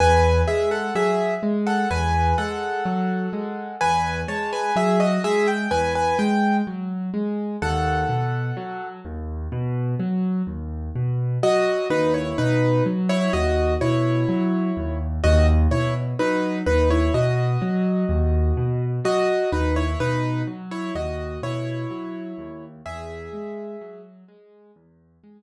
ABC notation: X:1
M:4/4
L:1/16
Q:1/4=63
K:E
V:1 name="Acoustic Grand Piano"
[Bg]2 [Ge] [Af] [Ge]2 z [Af] [Bg]2 [Af]6 | [Bg]2 [ca] [Bg] [Ge] [Fd] [Ge] =g [B^g] [Bg] =g2 z4 | [Af]6 z10 | [Fd]2 [DB] [Ec] [DB]2 z [Ec] [Fd]2 [Ec]6 |
[Fd] z [Ec] z [DB]2 [DB] [Ec] [Fd]8 | [Fd]2 [DB] [Ec] [DB]2 z [Ec] [Fd]2 [Ec]6 | [Ge]6 z10 |]
V:2 name="Acoustic Grand Piano" clef=bass
E,,2 G,2 F,2 G,2 E,,2 G,2 F,2 G,2 | E,,2 G,2 F,2 G,2 E,,2 G,2 F,2 G,2 | D,,2 B,,2 F,2 D,,2 B,,2 F,2 D,,2 B,,2 | F,2 D,,2 B,,2 F,2 D,,2 B,,2 F,2 D,,2 |
D,,2 B,,2 F,2 D,,2 B,,2 F,2 D,,2 B,,2 | F,2 D,,2 B,,2 F,2 D,,2 B,,2 F,2 D,,2 | E,,2 G,2 F,2 G,2 E,,2 G,2 z4 |]